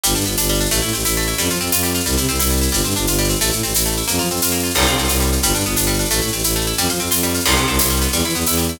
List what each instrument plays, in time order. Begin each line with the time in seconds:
0.04 violin G1, harpsichord G3, shaker
0.09 shaker
0.15 violin G2, harpsichord D4, shaker
0.21 shaker
0.26 violin G1, harpsichord B3, shaker
0.32 shaker
0.37 violin G1, harpsichord D4, tambourine, shaker
0.43 shaker
0.49 harpsichord G3, shaker
0.54 shaker
0.60 harpsichord D4, shaker
0.65 shaker
0.71 violin A1, harpsichord A3, shaker
0.77 shaker
0.82 violin A2, harpsichord E4, shaker
0.88 shaker
0.93 violin A1, harpsichord C4, shaker
0.99 shaker
1.05 violin A1, harpsichord E4, tambourine, shaker
1.10 shaker
1.16 harpsichord A3, shaker
1.22 shaker
1.27 harpsichord E4, shaker
1.33 shaker
1.38 violin F2, harpsichord G3, shaker
1.44 shaker
1.49 violin F3, harpsichord F4, shaker
1.55 shaker
1.61 violin F2, harpsichord C4, shaker
1.66 shaker
1.72 violin F2, harpsichord F4, tambourine, shaker
1.78 shaker
1.83 harpsichord G3, shaker
1.89 shaker
1.94 harpsichord F4, shaker
2.00 shaker
2.06 violin C2, harpsichord G3, shaker
2.12 shaker
2.17 violin C3, harpsichord E4, shaker
2.23 shaker
2.28 violin C2, harpsichord C4, shaker
2.34 shaker
2.39 violin C2, harpsichord E4, tambourine, shaker
2.46 shaker
2.50 harpsichord G3, shaker
2.57 shaker
2.61 harpsichord E4, shaker
2.68 shaker
2.72 violin G1, harpsichord G3, shaker
2.79 shaker
2.84 violin G2, harpsichord C4, shaker
2.90 shaker
2.96 violin G1, harpsichord D4, shaker
3.01 shaker
3.07 violin G1, harpsichord F4, tambourine, shaker
3.13 shaker
3.18 harpsichord G3, shaker
3.24 shaker
3.29 harpsichord C4, shaker
3.35 shaker
3.41 violin A1, harpsichord A3, shaker
3.46 shaker
3.51 violin A2, harpsichord E4, shaker
3.58 shaker
3.63 violin A1, harpsichord C4, shaker
3.69 shaker
3.74 violin A1, harpsichord E4, tambourine, shaker
3.80 shaker
3.86 harpsichord A3, shaker
3.91 shaker
3.97 harpsichord E4, shaker
4.03 shaker
4.08 violin F2, harpsichord A#3, shaker
4.14 shaker
4.19 violin F3, harpsichord F4, shaker
4.25 shaker
4.30 violin F2, harpsichord C4, shaker
4.36 shaker
4.42 violin F2, harpsichord F4, tambourine, shaker
4.48 shaker
4.52 harpsichord A#3, shaker
4.59 shaker
4.63 harpsichord F4, shaker
4.70 shaker
4.75 violin C2, harpsichord G3, crash
4.81 shaker
4.86 violin C3, harpsichord F4, shaker
4.93 shaker
4.97 violin C2, harpsichord C4, shaker
5.04 shaker
5.08 violin C2, harpsichord F4, tambourine, shaker
5.15 shaker
5.20 harpsichord G3, shaker
5.26 shaker
5.32 harpsichord F4, shaker
5.37 shaker
5.43 violin G1, harpsichord G3, shaker
5.48 shaker
5.54 violin G2, harpsichord D4, shaker
5.60 shaker
5.65 violin G1, harpsichord B3, shaker
5.71 shaker
5.76 violin G1, harpsichord D4, tambourine, shaker
5.83 shaker
5.87 harpsichord G3, shaker
5.94 shaker
5.99 harpsichord D4, shaker
6.05 shaker
6.11 violin A1, harpsichord A3, shaker
6.16 shaker
6.21 violin A2, harpsichord E4, shaker
6.27 shaker
6.33 violin A1, harpsichord C4, shaker
6.39 shaker
6.44 violin A1, harpsichord E4, tambourine, shaker
6.50 shaker
6.56 harpsichord A3, shaker
6.61 shaker
6.66 harpsichord E4, shaker
6.73 shaker
6.78 violin F2, harpsichord G3, shaker
6.83 shaker
6.89 violin F3, harpsichord F4, shaker
6.95 shaker
6.99 violin F2, harpsichord C4, shaker
7.06 shaker
7.11 violin F2, harpsichord F4, tambourine, shaker
7.17 shaker
7.23 harpsichord G3, shaker
7.29 shaker
7.34 harpsichord F4, shaker
7.40 shaker
7.46 violin C2, harpsichord G3, crash
7.51 shaker
7.56 violin C3, harpsichord B3, shaker
7.62 shaker
7.68 violin C2, harpsichord C4, shaker
7.74 shaker
7.79 violin C2, harpsichord E4, tambourine, shaker
7.84 shaker
7.90 harpsichord G3, shaker
7.96 shaker
8.01 harpsichord B3, shaker
8.07 shaker
8.12 violin E2, harpsichord G3, shaker
8.19 shaker
8.24 violin E3, harpsichord E4, shaker
8.29 shaker
8.34 violin E2, harpsichord B3, shaker
8.41 shaker
8.46 violin E2, harpsichord E4, tambourine, shaker
8.52 shaker
8.57 harpsichord G3, shaker
8.63 shaker
8.69 harpsichord E4, shaker
8.75 shaker